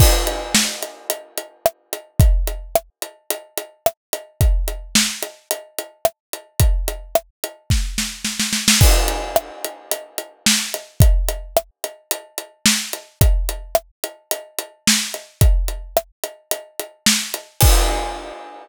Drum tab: CC |x---------------|----------------|----------------|----------------|
HH |--x---x-x-x---x-|x-x---x-x-x---x-|x-x---x-x-x---x-|x-x---x---------|
SD |----o-------r---|----r-------r---|----o-------r---|----r---o-o-oooo|
BD |o---------------|o---------------|o---------------|o-------o-------|

CC |x---------------|----------------|----------------|----------------|
HH |--x---x-x-x---x-|x-x---x-x-x---x-|x-x---x-x-x---x-|x-x---x-x-x---x-|
SD |----r-------o---|----r-------o---|----r-------o---|----r-------o---|
BD |o---------------|o---------------|o---------------|o---------------|

CC |x---------------|
HH |----------------|
SD |----------------|
BD |o---------------|